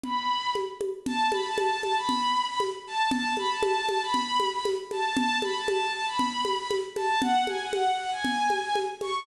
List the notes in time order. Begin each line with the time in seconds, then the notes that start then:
0.03 B5, low conga
0.55 high conga
0.81 high conga
1.06 A5, low conga
1.32 B5, high conga
1.45 A5
1.58 A5, high conga
1.83 A5, high conga
1.96 B5
2.09 low conga
2.48 B5
2.60 high conga
2.87 A5
3.11 A5, low conga
3.37 B5, high conga
3.49 A5
3.63 A5, high conga
3.89 A5, high conga
4.02 B5
4.14 low conga
4.40 high conga
4.53 B5
4.65 high conga
4.91 A5, high conga
5.17 A5, low conga
5.42 B5, high conga
5.54 A5
5.68 A5, high conga
5.93 A5
6.06 B5
6.19 low conga
6.45 high conga
6.59 B5
6.71 high conga
6.96 A5, high conga
7.22 F#5, low conga
7.47 G#5, high conga
7.60 F#5
7.73 F#5, high conga
7.98 F#5
8.11 G#5
8.24 low conga
8.50 high conga
8.62 G#5
8.75 high conga
9.01 C#6, high conga